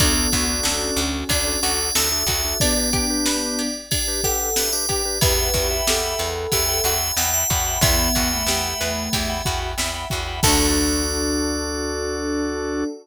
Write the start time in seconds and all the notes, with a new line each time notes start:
0.00 D2 B3 D4 F#4 A4 D5, kick, ride
0.17 D4 F#4 A4
0.32 D2 D4 F#4 A4, kick, ride
0.49 D4 F#4 A4
0.63 D2 C#4 A4, snare
0.96 D2 F#4, ride
1.29 D2 D4 D5, kick, ride
1.47 D4 F#4 A4
1.63 D2 D4 F#4 A4 D5, ride
1.95 D2 D4 F#4 A4 E5, snare
2.12 D4 F#4 A4 E5
2.26 D2 D4 F#4 A4, kick, ride
2.45 D4 F#4 A4
2.60 B3 D4 G4 B4 D5, kick, ride
2.77 D4 G4 B4
2.93 D4 G4 B4, kick, ride
3.10 D4 G4 B4
3.26 B4, snare
3.59 G4, ride
3.91 D4 G4 D5, kick, ride
4.08 D4 G4 B4
4.23 D4 G4 A4 B4 F#5, kick, ride
4.56 D4 G4 B4 E5, snare
4.73 D4 G4 B4 D5
4.89 D4 G4 B4, kick, ride
5.05 D4 G4 B4
5.21 E2 E4 G4 B4 E5 F#5 G5 B5, kick, ride
5.38 E5 F#5 G5 B5
5.54 E2 F#4 E5 F#5 G5 B5, kick, ride
5.70 E5 F#5 G5 B5
5.87 E2 G4 A4, snare
6.19 E2 B4, ride
6.52 E2 G4 E5, kick, ride
6.68 E5 F#5 G5 B5
6.84 E2 F#4 E5 F#5 G5 B5, ride
7.17 E2 E4 E5 F#5 G5 B5, snare
7.34 E5 F#5 G5 B5
7.50 E2 F#4 E5 F#5 G5 B5, kick, ride
7.66 E5 F#5 G5 B5
7.81 E2 B3 E4 E5 F#5 G5 B5, kick, ride
7.99 E5 F#5 G5 B5
8.15 E2 F#4 E5 F#5 G5 B5, kick, ride
8.32 A3 E5 F#5 G5 B5
8.46 E2 G4, snare
8.81 E2 B4, ride
9.13 E2 G4, kick, ride
9.29 E5 F#5 G5 B5
9.45 E2 F#4 E5 F#5 G5 B5, kick, ride
9.78 E2 E4 E5 F#5 G5 B5, snare
9.94 E5 F#5 G5 B5
10.10 E2 F#4 E5 F#5 G5 B5, kick, ride
10.27 E5 F#5 G5 B5
10.43 D2 D4 F#4 A4 D5, kick, crash
10.48 D4